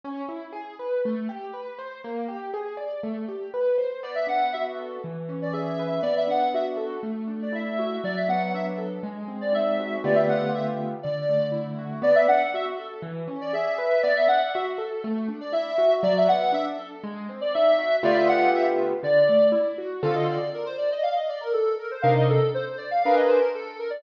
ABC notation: X:1
M:4/4
L:1/16
Q:1/4=120
K:Bphr
V:1 name="Ocarina"
z16 | z16 | d e f2 e z6 d e4 | d e f2 e z6 d e4 |
d e f2 e z6 d e4 | d e f2 e z3 d4 z4 | d e f2 e z6 d e4 | d e f2 e z6 d e4 |
d e f2 e z6 d e4 | d e f2 e z3 d4 z4 | [K:Dphr] f e d2 B c d e f e d B A2 B c | f e A2 c c d f f e c B A2 B d |]
V:2 name="Acoustic Grand Piano"
^C2 E2 ^G2 B2 A,2 =G2 B2 =c2 | _B,2 G2 _A2 d2 =A,2 G2 =B2 c2 | B,2 D2 F2 A2 E,2 ^C2 ^G2 B2 | B,2 D2 F2 A2 A,2 D2 E2 F2 |
F,2 B,2 D2 A2 _A,2 C2 _E2 _G2 | [D,A,B,=FG]8 D,2 A,2 E2 ^F2 | B,2 D2 F2 A2 E,2 ^C2 ^G2 B2 | B,2 D2 F2 A2 A,2 D2 E2 F2 |
F,2 B,2 D2 A2 _A,2 C2 _E2 _G2 | [D,A,B,=FG]8 D,2 A,2 E2 ^F2 | [K:Dphr] [D,CFA]16 | [C,DEB]8 [D_AB_c]8 |]